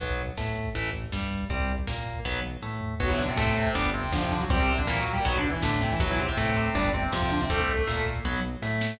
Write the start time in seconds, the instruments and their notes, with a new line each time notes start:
0.00 synth bass 1 B1, overdriven guitar F#3 B3, kick, crash
0.09 kick
0.19 kick, closed hi-hat
0.28 kick
0.37 synth bass 1 A2, overdriven guitar A3, kick, snare
0.47 kick
0.56 kick, closed hi-hat
0.65 kick
0.75 synth bass 1 A1, overdriven guitar E3 A3, kick, closed hi-hat
0.85 kick
0.94 kick, closed hi-hat
1.03 kick
1.12 synth bass 1 G2, overdriven guitar G3, kick, snare
1.22 kick
1.31 kick, closed hi-hat
1.41 kick
1.49 synth bass 1 C2, overdriven guitar G3 C4, kick, closed hi-hat
1.59 kick
1.69 kick, closed hi-hat
1.78 kick
1.87 synth bass 1 A#2, overdriven guitar A#3, kick, snare
1.97 kick
2.06 kick, closed hi-hat
2.15 kick
2.25 synth bass 1 B1, overdriven guitar F#3 B3, kick
2.44 high tom
2.62 synth bass 1 A2, overdriven guitar A3
2.81 floor tom
3.00 synth bass 1 B1, distortion guitar F#3 F#4, overdriven guitar F#3 B3, kick, crash
3.09 distortion guitar E3 E4, kick
3.19 distortion guitar D3 D4, kick, closed hi-hat
3.28 distortion guitar C3 C4, kick
3.36 synth bass 1 A2, distortion guitar C3 C4, overdriven guitar A3, kick, snare
3.47 kick
3.56 distortion guitar C3 C4, kick, closed hi-hat
3.65 kick
3.75 synth bass 1 G1, overdriven guitar G3 B3 D4, kick, closed hi-hat
3.84 kick
3.94 distortion guitar C3 C4, kick, closed hi-hat
4.03 kick
4.12 synth bass 1 F2, distortion guitar D3 D4, overdriven guitar F3, kick, snare
4.22 distortion guitar C3 C4, kick
4.31 distortion guitar D3 D4, kick, closed hi-hat
4.41 distortion guitar F#3 F#4, kick
4.50 synth bass 1 C2, distortion guitar G3 G4, overdriven guitar G3 C4, kick, closed hi-hat
4.59 distortion guitar C3 C4, kick
4.69 kick, closed hi-hat
4.78 distortion guitar D3 D4, kick
4.87 synth bass 1 A#2, distortion guitar E3 E4, overdriven guitar A#3, kick, snare
4.97 distortion guitar F#3 F#4, kick
5.06 kick, closed hi-hat
5.12 distortion guitar G3 G4, kick
5.25 synth bass 1 B1, distortion guitar F#3 F#4, overdriven guitar F#3 B3, kick, closed hi-hat
5.34 distortion guitar D3 D4, kick
5.44 kick, closed hi-hat
5.50 distortion guitar E3 E4, kick
5.62 synth bass 1 A2, distortion guitar D3 D4, overdriven guitar A3, kick, snare
5.72 kick
5.81 distortion guitar C3 C4, kick, closed hi-hat
5.91 distortion guitar E3 E4, kick
6.00 synth bass 1 B1, distortion guitar F#3 F#4, overdriven guitar F#3 B3, kick, closed hi-hat
6.09 distortion guitar E3 E4, kick
6.19 distortion guitar C3 C4, kick, closed hi-hat
6.28 distortion guitar C3 C4, kick
6.37 synth bass 1 A2, distortion guitar C3 C4, overdriven guitar A3, kick, snare
6.47 kick
6.56 distortion guitar C3 C4, kick, closed hi-hat
6.66 kick
6.75 synth bass 1 G1, overdriven guitar G3 B3 D4, kick, closed hi-hat
6.84 kick
6.94 distortion guitar C3 C4, kick, closed hi-hat
7.03 kick
7.12 synth bass 1 F2, distortion guitar C3 C4, overdriven guitar F3, kick, snare
7.22 distortion guitar C3 C4, kick
7.31 distortion guitar D3 D4, kick, closed hi-hat
7.41 distortion guitar C3 C4, kick
7.50 synth bass 1 C2, overdriven guitar G3 C4, distortion guitar A3 A4, kick, closed hi-hat
7.59 kick
7.69 kick, closed hi-hat
7.78 kick
7.87 synth bass 1 A#2, overdriven guitar A#3, kick, snare
7.97 kick
8.06 kick, closed hi-hat
8.15 kick
8.24 synth bass 1 B1, overdriven guitar F#3 B3, kick
8.62 synth bass 1 A2, overdriven guitar A3, snare
8.81 snare